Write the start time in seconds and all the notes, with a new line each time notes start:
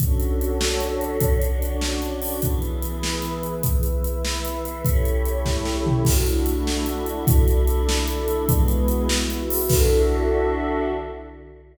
0.00 D3 C#4 D4 F#4 A4 C#5, kick, closed hi-hat
0.20 closed hi-hat
0.41 closed hi-hat
0.61 snare
0.80 closed hi-hat
1.01 closed hi-hat
1.21 D4 F#4 C#5 D5, kick, closed hi-hat
1.42 closed hi-hat
1.62 closed hi-hat
1.81 snare
2.02 closed hi-hat
2.22 open hi-hat
2.42 E3 B3 E4 G#4 B4, kick, closed hi-hat
2.62 closed hi-hat
2.82 closed hi-hat
3.03 snare
3.22 closed hi-hat
3.43 closed hi-hat
3.63 E4 B4 E5, kick, closed hi-hat
3.83 closed hi-hat
4.04 closed hi-hat
4.25 snare
4.45 closed hi-hat
4.65 closed hi-hat
4.85 A3 C#4 E4 G4 C#5, kick, closed hi-hat
5.05 closed hi-hat
5.25 closed hi-hat
5.45 kick, snare
5.65 snare
5.86 floor tom
6.05 D3 A3 D4 E4 F#4 A4, kick, crash
6.26 closed hi-hat
6.46 closed hi-hat
6.67 snare
6.86 closed hi-hat
7.06 closed hi-hat
7.27 D4 E4 A4 D5, kick, closed hi-hat
7.48 closed hi-hat
7.67 closed hi-hat
7.89 snare
8.08 closed hi-hat
8.28 closed hi-hat
8.48 E3 G#3 B3 E4 F#4 G#4 B4, kick, closed hi-hat
8.68 closed hi-hat
8.88 closed hi-hat
9.09 E4 F#4 B4 E5, snare
9.30 closed hi-hat
9.50 open hi-hat
9.69 D3 D4 E4 F#4 A4 E5, kick, crash